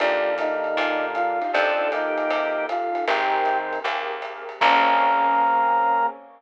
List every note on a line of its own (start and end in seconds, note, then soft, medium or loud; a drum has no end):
0.00 0.68 D#2 medium
0.00 1.39 D3 medium
0.00 1.39 A#3 medium
0.00 1.52 D4 medium
0.00 0.35 D4 medium
0.00 0.31 D4 medium
0.00 1.52 D#4 medium
0.00 0.31 D#4 medium
0.00 1.52 F4 medium
0.00 0.31 F4 medium
0.00 1.52 G4 medium
0.00 0.31 G4 medium
0.00 0.35 D5 medium
0.00 ride medium
0.38 1.06 D#4 medium
0.38 1.06 D#5 medium
0.38 kick medium
0.38 hi-hat pedal medium
0.38 ride medium
0.64 ride soft
0.77 1.44 A#2 medium
0.77 1.08 D4 medium
0.77 1.08 D#4 medium
0.77 1.08 F4 medium
0.77 1.08 G4 medium
0.77 kick soft
0.77 ride loud
1.15 1.52 F4 medium
1.15 1.52 F5 medium
1.15 hi-hat pedal medium
1.15 ride medium
1.41 1.50 D4 medium
1.41 1.50 D#4 medium
1.41 1.50 F4 medium
1.41 1.50 G4 medium
1.41 ride medium
1.53 2.21 F2 loud
1.53 1.88 C4 medium
1.53 1.91 D4 medium
1.53 1.71 D#4 medium
1.53 3.06 D#4 medium
1.53 1.71 F4 medium
1.53 3.06 F4 medium
1.53 1.71 G4 medium
1.53 3.06 G4 medium
1.53 1.71 A4 loud
1.53 3.06 A4 medium
1.53 1.88 A4 medium
1.53 1.91 D5 medium
1.53 ride medium
1.79 2.02 D#4 medium
1.79 2.02 F4 medium
1.79 2.02 G4 medium
1.79 2.02 A4 medium
1.92 2.67 A#3 medium
1.92 2.65 D#4 medium
1.92 2.67 G4 medium
1.92 2.65 D#5 medium
1.92 hi-hat pedal medium
1.92 ride medium
2.18 ride medium
2.30 2.97 C3 medium
2.30 ride medium
2.69 3.05 F4 medium
2.69 3.05 F5 medium
2.69 hi-hat pedal medium
2.69 ride medium
2.95 ride medium
3.07 3.74 G#1 medium
3.07 3.79 D#3 medium
3.07 3.38 C4 medium
3.07 3.79 C4 medium
3.07 4.61 C4 medium
3.07 3.38 G4 medium
3.07 4.61 G4 medium
3.07 3.58 G4 medium
3.07 3.38 G#4 medium
3.07 4.61 G#4 medium
3.07 3.38 A#4 medium
3.07 4.61 A#4 medium
3.07 3.58 G5 medium
3.07 kick medium
3.07 ride loud
3.45 kick medium
3.45 hi-hat pedal medium
3.45 ride medium
3.73 ride medium
3.84 4.51 D#2 medium
3.84 4.15 C4 medium
3.84 4.15 G4 medium
3.84 4.15 G#4 medium
3.84 4.15 A#4 medium
3.84 ride medium
4.22 hi-hat pedal medium
4.22 ride medium
4.49 ride medium
4.60 6.07 A#1 loud
4.60 6.07 A#3 loud
4.60 6.07 C4 loud
4.60 6.07 C#4 loud
4.60 6.07 G#4 medium
4.60 6.06 A#5 loud
4.60 kick loud
4.60 crash loud